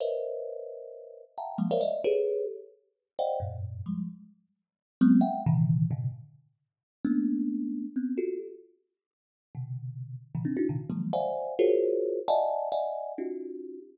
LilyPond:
\new Staff { \time 9/8 \tempo 4. = 88 <ais' b' c'' cis'' dis'' e''>2. <e'' f'' fis'' g'' a'' ais''>8 <f g gis ais>16 <ais' c'' cis'' d'' e'' f''>16 <d'' dis'' e''>8 | <g' gis' a' b' cis''>4 r4. <c'' d'' dis'' f'' fis'' g''>8 <fis, g, gis, ais,>4 <f g gis>8 | r2 <fis gis ais b c'>8 <e'' fis'' g''>8 <ais, c d dis e>4 <gis, ais, b, c cis d>8 | r2 <a ais b cis' d'>2 <b c' cis'>8 |
<f' fis' g' a'>8 r2 r8 <b, c d>4. | r16 <a, b, cis dis e>16 <c' d' dis'>16 <d' dis' e' fis'>16 <ais, c d dis>16 r16 <d dis f fis gis ais>8 <c'' d'' e'' f'' fis'' gis''>4 <f' fis' gis' ais' c'' cis''>4. | <d'' dis'' e'' fis'' gis'' a''>4 <d'' dis'' e'' fis'' gis''>4 <cis' dis' f' fis' g'>4. r4 | }